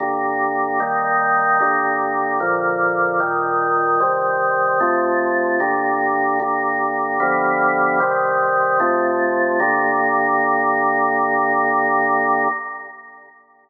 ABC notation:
X:1
M:4/4
L:1/8
Q:1/4=75
K:Gm
V:1 name="Drawbar Organ"
[G,,D,B,]2 [E,G,B,]2 [G,,D,B,]2 [B,,D,F,]2 | [B,,E,G,]2 [C,E,G,]2 [F,,C,A,]2 [G,,D,B,]2 | [G,,D,B,]2 [G,,D,F,=B,]2 [C,E,G,]2 [F,,C,A,]2 | [G,,D,B,]8 |]